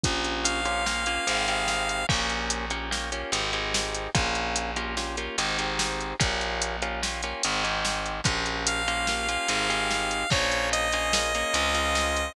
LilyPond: <<
  \new Staff \with { instrumentName = "Lead 1 (square)" } { \time 5/4 \key bes \minor \tempo 4 = 146 r4 f''1 | r1 r4 | r1 r4 | r1 r4 |
r4 f''1 | des''4 ees''1 | }
  \new Staff \with { instrumentName = "Acoustic Guitar (steel)" } { \time 5/4 \key bes \minor <bes des' f' g'>4. <bes des' f' g'>8 <bes des' f' g'>8 <bes des' f' g'>8 <c' ees' g' aes'>8 <c' ees' g' aes'>4. | <bes des' f' g'>4. <bes des' f' g'>8 <bes des' f' g'>8 <bes des' f' g'>8 <c' ees' g' aes'>8 <c' ees' g' aes'>4. | <bes des' f' g'>4. <bes des' f' g'>8 <bes des' f' g'>8 <bes des' f' g'>8 <c' ees' g' aes'>8 <c' ees' g' aes'>4. | <bes des' f' g'>4. <bes des' f' g'>8 <bes des' f' g'>8 <bes des' f' g'>8 <c' ees' g' aes'>8 <c' ees' g' aes'>4. |
<bes des' f' g'>4. <bes des' f' g'>8 <bes des' f' g'>8 <bes des' f' g'>8 <c' ees' g' aes'>8 <c' ees' g' aes'>4. | <bes des' f' aes'>4. <bes des' f' aes'>8 <bes des' f' aes'>8 <bes des' f' aes'>8 <c' des' f' aes'>8 <c' des' f' aes'>4. | }
  \new Staff \with { instrumentName = "Electric Bass (finger)" } { \clef bass \time 5/4 \key bes \minor bes,,2. aes,,2 | bes,,2. aes,,2 | bes,,2. aes,,2 | bes,,2. aes,,2 |
bes,,2. aes,,2 | bes,,2. des,2 | }
  \new DrumStaff \with { instrumentName = "Drums" } \drummode { \time 5/4 <hh bd>8 hh8 hh8 hh8 sn8 hh8 hh8 hh8 sn8 hh8 | <cymc bd>8 hh8 hh8 hh8 sn8 hh8 hh8 hh8 sn8 hh8 | <hh bd>8 hh8 hh8 hh8 sn8 hh8 hh8 hh8 sn8 hh8 | <hh bd>8 hh8 hh8 hh8 sn8 hh8 hh8 hh8 sn8 hh8 |
<hh bd>8 hh8 hh8 hh8 sn8 hh8 hh8 hh8 sn8 hh8 | <cymc bd>8 hh8 hh8 hh8 sn8 hh8 hh8 hh8 sn8 hh8 | }
>>